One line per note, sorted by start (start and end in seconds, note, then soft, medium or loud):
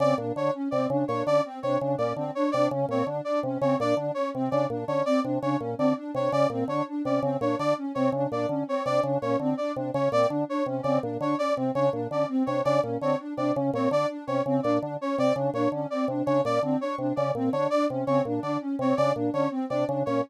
0.00 0.14 C#3 medium
0.00 0.14 C4 medium
0.00 0.15 D5 medium
0.18 0.32 A#2 medium
0.18 0.32 D4 medium
0.36 0.50 D3 medium
0.36 0.51 D4 medium
0.36 0.51 C#5 medium
0.54 0.68 C#4 medium
0.71 0.87 C3 medium
0.71 0.87 C4 medium
0.71 0.85 D5 medium
0.90 1.04 C#3 medium
0.90 1.05 D4 medium
1.08 1.23 A#2 medium
1.08 1.23 D4 medium
1.08 1.22 C#5 medium
1.27 1.41 D3 medium
1.27 1.41 C#4 medium
1.27 1.41 D5 medium
1.45 1.59 C4 medium
1.63 1.78 C3 medium
1.63 1.77 D4 medium
1.63 1.77 C#5 medium
1.81 1.96 C#3 medium
1.81 1.95 D4 medium
1.98 2.13 A#2 medium
1.98 2.13 C#4 medium
1.98 2.13 D5 medium
2.16 2.31 D3 medium
2.16 2.31 C4 medium
2.35 2.50 D4 medium
2.35 2.49 C#5 medium
2.52 2.68 C3 medium
2.52 2.69 D4 medium
2.52 2.66 D5 medium
2.71 2.86 C#3 medium
2.71 2.86 C#4 medium
2.89 3.03 A#2 medium
2.89 3.04 C4 medium
2.89 3.05 C#5 medium
3.07 3.21 D3 medium
3.07 3.22 D4 medium
3.25 3.40 D4 medium
3.25 3.39 D5 medium
3.43 3.58 C3 medium
3.43 3.59 C#4 medium
3.61 3.76 C#3 medium
3.61 3.76 C4 medium
3.61 3.76 C#5 medium
3.79 3.94 A#2 medium
3.79 3.94 D4 medium
3.79 3.95 D5 medium
3.97 4.11 D3 medium
3.97 4.12 D4 medium
4.14 4.30 C#4 medium
4.14 4.29 C#5 medium
4.35 4.49 C3 medium
4.35 4.49 C4 medium
4.51 4.66 C#3 medium
4.51 4.66 D4 medium
4.51 4.66 D5 medium
4.70 4.84 A#2 medium
4.70 4.85 D4 medium
4.88 5.02 D3 medium
4.88 5.02 C#4 medium
4.88 5.02 C#5 medium
5.06 5.20 C4 medium
5.06 5.20 D5 medium
5.24 5.39 C3 medium
5.24 5.38 D4 medium
5.42 5.57 C#3 medium
5.42 5.57 D4 medium
5.42 5.57 C#5 medium
5.59 5.75 A#2 medium
5.59 5.74 C#4 medium
5.78 5.94 D3 medium
5.78 5.93 C4 medium
5.78 5.93 D5 medium
5.97 6.11 D4 medium
6.14 6.29 C3 medium
6.14 6.29 D4 medium
6.14 6.30 C#5 medium
6.32 6.47 C#3 medium
6.32 6.47 C#4 medium
6.32 6.47 D5 medium
6.50 6.64 A#2 medium
6.50 6.65 C4 medium
6.68 6.82 D3 medium
6.68 6.83 D4 medium
6.68 6.83 C#5 medium
6.88 7.02 D4 medium
7.05 7.20 C3 medium
7.05 7.19 C#4 medium
7.05 7.20 D5 medium
7.22 7.37 C#3 medium
7.22 7.37 C4 medium
7.41 7.55 A#2 medium
7.41 7.55 D4 medium
7.41 7.55 C#5 medium
7.59 7.74 D3 medium
7.59 7.74 D4 medium
7.59 7.74 D5 medium
7.78 7.92 C#4 medium
7.95 8.10 C3 medium
7.95 8.09 C4 medium
7.95 8.09 C#5 medium
8.12 8.27 C#3 medium
8.12 8.28 D4 medium
8.31 8.46 A#2 medium
8.31 8.46 D4 medium
8.31 8.46 D5 medium
8.49 8.63 D3 medium
8.49 8.64 C#4 medium
8.67 8.82 C4 medium
8.67 8.83 C#5 medium
8.86 9.00 C3 medium
8.86 9.00 D4 medium
8.86 9.00 D5 medium
9.03 9.18 C#3 medium
9.03 9.18 D4 medium
9.22 9.37 A#2 medium
9.22 9.37 C#4 medium
9.22 9.36 C#5 medium
9.40 9.54 D3 medium
9.40 9.55 C4 medium
9.57 9.72 D4 medium
9.57 9.72 D5 medium
9.76 9.91 C3 medium
9.76 9.91 D4 medium
9.94 10.09 C#3 medium
9.94 10.08 C#4 medium
9.94 10.09 C#5 medium
10.12 10.26 A#2 medium
10.12 10.27 C4 medium
10.12 10.27 D5 medium
10.29 10.45 D3 medium
10.29 10.44 D4 medium
10.48 10.63 D4 medium
10.48 10.64 C#5 medium
10.66 10.81 C3 medium
10.66 10.82 C#4 medium
10.83 10.99 C#3 medium
10.83 11.00 C4 medium
10.83 10.97 D5 medium
11.02 11.18 A#2 medium
11.02 11.17 D4 medium
11.20 11.35 D3 medium
11.20 11.35 D4 medium
11.20 11.36 C#5 medium
11.38 11.53 C#4 medium
11.38 11.53 D5 medium
11.56 11.72 C3 medium
11.56 11.70 C4 medium
11.75 11.90 C#3 medium
11.75 11.90 D4 medium
11.75 11.89 C#5 medium
11.93 12.07 A#2 medium
11.93 12.07 D4 medium
12.10 12.25 D3 medium
12.10 12.25 C#4 medium
12.10 12.26 D5 medium
12.29 12.43 C4 medium
12.46 12.62 C3 medium
12.46 12.61 D4 medium
12.46 12.61 C#5 medium
12.65 12.80 C#3 medium
12.65 12.80 D4 medium
12.65 12.79 D5 medium
12.82 12.98 A#2 medium
12.82 12.97 C#4 medium
13.01 13.16 D3 medium
13.01 13.16 C4 medium
13.01 13.16 C#5 medium
13.19 13.34 D4 medium
13.37 13.52 C3 medium
13.37 13.52 D4 medium
13.37 13.52 D5 medium
13.55 13.71 C#3 medium
13.55 13.70 C#4 medium
13.73 13.88 A#2 medium
13.73 13.88 C4 medium
13.73 13.89 C#5 medium
13.91 14.06 D3 medium
13.91 14.06 D4 medium
13.91 14.07 D5 medium
14.10 14.24 D4 medium
14.27 14.42 C3 medium
14.27 14.42 C#4 medium
14.27 14.42 C#5 medium
14.46 14.60 C#3 medium
14.46 14.61 C4 medium
14.63 14.79 A#2 medium
14.63 14.77 D4 medium
14.63 14.77 D5 medium
14.81 14.97 D3 medium
14.81 14.95 D4 medium
15.01 15.15 C#4 medium
15.01 15.16 C#5 medium
15.17 15.33 C3 medium
15.17 15.32 C4 medium
15.17 15.33 D5 medium
15.36 15.50 C#3 medium
15.36 15.50 D4 medium
15.54 15.68 A#2 medium
15.54 15.69 D4 medium
15.54 15.69 C#5 medium
15.72 15.86 D3 medium
15.72 15.87 C#4 medium
15.90 16.05 C4 medium
15.90 16.05 D5 medium
16.08 16.22 C3 medium
16.08 16.23 D4 medium
16.26 16.41 C#3 medium
16.26 16.40 D4 medium
16.26 16.41 C#5 medium
16.44 16.59 A#2 medium
16.44 16.59 C#4 medium
16.44 16.60 D5 medium
16.63 16.77 D3 medium
16.63 16.78 C4 medium
16.81 16.95 D4 medium
16.81 16.95 C#5 medium
16.98 17.13 C3 medium
16.98 17.13 D4 medium
17.16 17.32 C#3 medium
17.16 17.30 C#4 medium
17.16 17.31 D5 medium
17.35 17.49 A#2 medium
17.35 17.50 C4 medium
17.53 17.67 D3 medium
17.53 17.67 D4 medium
17.53 17.67 C#5 medium
17.70 17.87 D4 medium
17.70 17.85 D5 medium
17.89 18.05 C3 medium
17.89 18.04 C#4 medium
18.07 18.22 C#3 medium
18.07 18.22 C4 medium
18.07 18.21 C#5 medium
18.25 18.40 A#2 medium
18.25 18.41 D4 medium
18.43 18.57 D3 medium
18.43 18.58 D4 medium
18.43 18.57 D5 medium
18.61 18.75 C#4 medium
18.79 18.93 C3 medium
18.79 18.94 C4 medium
18.79 18.95 C#5 medium
18.97 19.13 C#3 medium
18.97 19.12 D4 medium
18.97 19.11 D5 medium
19.15 19.30 A#2 medium
19.15 19.30 D4 medium
19.33 19.48 D3 medium
19.33 19.47 C#4 medium
19.33 19.48 C#5 medium
19.51 19.65 C4 medium
19.70 19.85 C3 medium
19.70 19.84 D4 medium
19.70 19.84 D5 medium
19.88 20.03 C#3 medium
19.88 20.02 D4 medium
20.06 20.21 A#2 medium
20.06 20.21 C#4 medium
20.06 20.20 C#5 medium